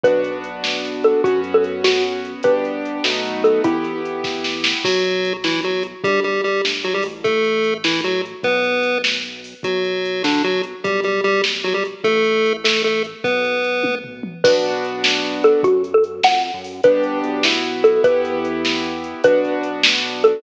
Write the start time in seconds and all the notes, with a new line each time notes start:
0.04 B1 B3 D4 F#4 B4, kick, closed hi-hat
0.24 closed hi-hat
0.44 closed hi-hat
0.64 snare
0.85 closed hi-hat
1.04 A4, closed hi-hat
1.24 F#2 B3 C#4 F#4, kick, closed hi-hat
1.44 closed hi-hat
1.54 A4
1.64 closed hi-hat
1.84 F#4, snare
2.04 closed hi-hat
2.25 closed hi-hat
2.43 G1 B3 D4 G4 B4, kick, closed hi-hat
2.65 closed hi-hat
2.85 closed hi-hat
3.04 B1 A3 B3 D#4 F#4, snare
3.26 closed hi-hat
3.44 A4, closed hi-hat
3.64 E2 B3 E4 G4, kick, closed hi-hat
3.84 closed hi-hat
4.05 closed hi-hat
4.24 kick, snare
4.44 snare
4.64 snare
4.84 B1 F#3 F#4, kick, crash
5.04 closed hi-hat
5.25 closed hi-hat
5.44 E3 E4, snare
5.63 F#3 F#4, closed hi-hat
5.83 closed hi-hat
6.04 G1 G3 G4, kick, closed hi-hat
6.24 G3 G4, closed hi-hat
6.44 G3 G4, closed hi-hat
6.64 G1, snare
6.83 F#3 F#4, closed hi-hat
6.94 G#1 G3 G4
7.03 A1, open hi-hat
7.24 A3 A4, kick, closed hi-hat
7.44 closed hi-hat
7.64 closed hi-hat
7.84 E3 E4, snare
8.04 F#3 F#4, closed hi-hat
8.25 closed hi-hat
8.43 B1 B3 B4, kick, closed hi-hat
8.64 closed hi-hat
8.83 closed hi-hat
9.04 snare
9.25 closed hi-hat
9.44 open hi-hat
9.63 B1 F#3 F#4, kick, closed hi-hat
9.84 closed hi-hat
10.05 closed hi-hat
10.24 D3 D4, snare
10.44 F#3 F#4, closed hi-hat
10.63 closed hi-hat
10.84 B1 G3 G4, kick, closed hi-hat
11.04 G3 G4, closed hi-hat
11.24 G3 G4, closed hi-hat
11.44 snare
11.64 F#3 F#4, closed hi-hat
11.74 G3 G4
11.85 closed hi-hat
12.04 A1 A3 A4, kick, closed hi-hat
12.24 closed hi-hat
12.46 closed hi-hat
12.64 A3 A4, snare
12.83 A3 A4, closed hi-hat
13.04 closed hi-hat
13.24 B1 B3 B4, kick, closed hi-hat
13.44 closed hi-hat
13.64 closed hi-hat
13.83 kick, high tom
14.04 floor tom
14.23 mid tom
14.44 B1 B3 D4 F#4 B4, kick, crash
14.64 closed hi-hat
14.84 closed hi-hat
15.04 snare
15.24 closed hi-hat
15.44 A4, closed hi-hat
15.63 F#2 F#4, kick, closed hi-hat
15.84 closed hi-hat
15.94 A4
16.04 closed hi-hat
16.23 F2 F#5, snare
16.44 closed hi-hat
16.54 F#2
16.64 open hi-hat
16.84 G1 B3 D4 G4 B4, kick, closed hi-hat
17.03 closed hi-hat
17.24 B1, closed hi-hat
17.43 B3 E4 F#4, snare
17.64 closed hi-hat
17.84 A4, closed hi-hat
18.04 E2 B3 E4 G4 B4, kick, closed hi-hat
18.25 closed hi-hat
18.45 closed hi-hat
18.65 snare
18.84 closed hi-hat
19.04 closed hi-hat
19.24 B1 B3 D4 F#4 B4, kick, closed hi-hat
19.45 closed hi-hat
19.63 closed hi-hat
19.83 snare
20.04 closed hi-hat
20.23 A4, closed hi-hat